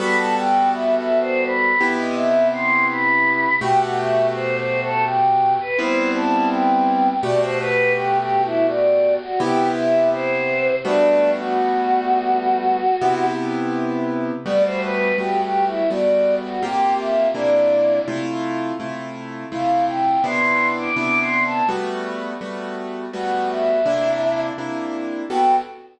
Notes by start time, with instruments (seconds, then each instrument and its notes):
0.00 acoustic grand piano G3 B3 F#4 A4, choir aahs B5
0.18 choir aahs A5
0.36 choir aahs G5
0.72 choir aahs E5
0.96 choir aahs E5
1.20 choir aahs C5
1.45 choir aahs B5
1.80 acoustic grand piano C3 B3 E4 G4
1.99 choir aahs D#5
2.17 choir aahs E5
2.53 choir aahs C6
2.89 choir aahs B5
3.61 acoustic grand piano B2 A3 F#4 G4, choir aahs G5
3.80 choir aahs F#5
3.98 choir aahs E5
4.34 choir aahs C5
4.58 choir aahs C5
4.82 choir aahs A4
5.06 choir aahs G5
5.60 choir aahs B4
5.78 acoustic grand piano G3 B3 C4 E4, choir aahs C5
6.15 choir aahs A5
6.51 choir aahs G5
7.23 acoustic grand piano B2 A3 F#4 G4, choir aahs D5
7.41 choir aahs C5
7.59 choir aahs B4
7.95 choir aahs G4
8.19 choir aahs G4
8.43 choir aahs E4
8.68 choir aahs D5
9.22 choir aahs F#4
9.40 acoustic grand piano C3 B3 E4 G4, choir aahs G4
9.76 choir aahs E5
10.12 choir aahs C5
10.84 acoustic grand piano G3 A3 B3 F#4, choir aahs D4
11.39 choir aahs F#4
13.01 acoustic grand piano C3 B3 E4 G4
14.46 acoustic grand piano G3 A3 B3 F#4, choir aahs D5
14.64 choir aahs C5
14.82 choir aahs B4
15.18 acoustic grand piano G3 A3 B3 F#4, choir aahs G4
15.42 choir aahs G4
15.66 choir aahs E4
15.90 acoustic grand piano G3 A3 B3 F#4, choir aahs D5
16.44 choir aahs F#4
16.63 acoustic grand piano C3 A#3 F4 G4, choir aahs G4
16.99 choir aahs E5
17.34 acoustic grand piano C3 A#3 D4 E4, choir aahs D5
18.08 acoustic grand piano C3 A3 E4 F4
18.80 acoustic grand piano C3 A3 E4 F4
19.52 acoustic grand piano C3 A3 E4 F4, choir aahs F5
19.88 choir aahs G5
20.24 acoustic grand piano C3 B3 D4 E4, choir aahs C6
20.78 choir aahs D6
20.96 acoustic grand piano C3 B3 D4 E4, choir aahs D6
21.20 choir aahs C6
21.45 choir aahs A5
21.69 acoustic grand piano G3 A3 B3 F#4
22.41 acoustic grand piano G3 A3 B3 F#4
23.13 acoustic grand piano G3 A3 B3 F#4, choir aahs F#5
23.49 choir aahs E5
23.86 acoustic grand piano C3 A#3 D4 E4
24.58 acoustic grand piano C3 A#3 D4 E4
25.30 acoustic grand piano G3 B3 F#4 A4, choir aahs G5